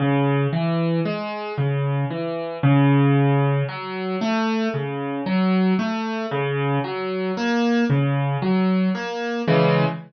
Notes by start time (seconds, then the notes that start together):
0.00 C#3
0.53 E3
1.05 G#3
1.58 C#3
2.11 E3
2.63 C#3
3.68 F#3
4.21 A3
4.74 C#3
5.26 F#3
5.79 A3
6.31 C#3
6.84 F#3
7.37 A#3
7.90 C#3
8.42 F#3
8.95 A#3
9.48 C#3 E3 G#3